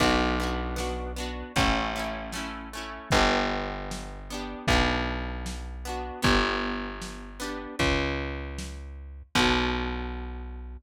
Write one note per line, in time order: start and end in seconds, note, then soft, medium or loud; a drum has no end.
0.00 1.43 B1 loud
0.00 0.35 B3 medium
0.00 0.35 D4 medium
0.00 0.35 F#4 loud
0.00 kick loud
0.00 crash loud
0.40 0.75 B3 medium
0.40 0.75 D4 medium
0.40 0.75 F#4 medium
0.76 1.12 B3 medium
0.76 1.12 D4 medium
0.76 1.12 F#4 medium
0.76 snare loud
1.16 1.52 B3 medium
1.16 1.52 D4 medium
1.16 1.52 F#4 medium
1.56 2.99 A1 medium
1.56 1.92 A3 medium
1.56 1.92 C#4 medium
1.56 1.92 E4 loud
1.56 kick loud
1.56 closed hi-hat loud
1.96 2.31 A3 medium
1.96 2.31 C#4 medium
1.96 2.31 E4 medium
2.32 2.69 A3 medium
2.32 2.69 C#4 medium
2.32 snare loud
2.37 2.69 E4 medium
2.73 3.09 A3 medium
2.73 3.09 C#4 medium
2.73 3.09 E4 medium
3.11 4.55 G1 loud
3.11 4.19 B3 loud
3.11 4.19 D4 loud
3.11 kick loud
3.11 closed hi-hat loud
3.16 4.19 G4 medium
3.91 snare loud
4.30 4.66 B3 medium
4.30 4.66 D4 medium
4.30 4.66 G4 medium
4.67 6.11 B1 loud
4.67 5.76 B3 medium
4.67 5.76 D4 medium
4.67 kick loud
4.72 5.76 F#4 medium
5.46 snare loud
5.85 6.21 B3 medium
5.85 6.21 D4 medium
5.85 6.21 F#4 medium
6.22 7.67 G1 medium
6.22 7.30 B3 medium
6.22 7.30 D4 medium
6.22 7.30 G4 loud
6.22 kick loud
6.22 closed hi-hat loud
7.02 snare loud
7.40 7.75 B3 medium
7.40 7.75 D4 medium
7.40 7.75 G4 medium
7.79 9.23 C#2 medium
7.79 kick loud
7.79 closed hi-hat loud
8.58 snare loud
9.35 10.77 B1 loud
9.35 10.77 B3 loud
9.35 10.77 D4 medium
9.35 10.77 F#4 loud
9.35 kick loud
9.35 crash loud